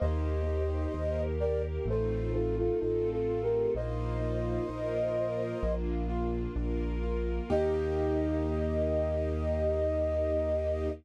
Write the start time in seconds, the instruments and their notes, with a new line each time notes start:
0.00 acoustic grand piano D#2 A#3, string ensemble 1 A#3 D#4 G4, flute C5 D#5
0.47 acoustic grand piano G4
0.94 acoustic grand piano D#2 D#4, string ensemble 1 A#3 G4 A#4
1.40 acoustic grand piano G4, flute A#4 D5
1.86 acoustic grand piano A1 A3, string ensemble 1 A3 C4 D#4 F4, flute A4 C5
2.33 flute F4 A4, acoustic grand piano F4
2.58 flute F4 A4
2.80 acoustic grand piano A1 D#4, string ensemble 1 A3 C4 F4 A4, flute F4 A4
3.12 flute F4 A4
3.28 acoustic grand piano F4
3.42 flute G4 A#4
3.75 acoustic grand piano A#1 A#3, string ensemble 1 A#3 D#4 F4, flute C5 D#5
4.22 acoustic grand piano F4
4.69 acoustic grand piano A#1 D#4, string ensemble 1 A#3 F4 A#4
5.16 acoustic grand piano F4
5.62 acoustic grand piano A#1 A#3, string ensemble 1 A#3 D4 F4
6.09 acoustic grand piano F4
6.56 acoustic grand piano A#1 D4, string ensemble 1 A#3 F4 A#4
7.03 acoustic grand piano F4
7.50 acoustic grand piano D#2 A#3 D#4 G4, string ensemble 1 A#3 D#4 G4, flute D#5